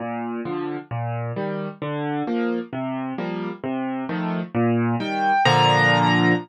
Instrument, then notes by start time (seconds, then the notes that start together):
acoustic grand piano
0.00 A#2
0.45 D3 F3
0.91 A#2
1.36 D#3 G3
1.82 D3
2.27 F3 A#3
2.73 C3
3.18 F3 G3 A#3
3.64 C3
4.09 D#3 F3 A3
4.55 A#2
5.00 D#3 G3 G5
5.45 A#2 D3 F3 A#5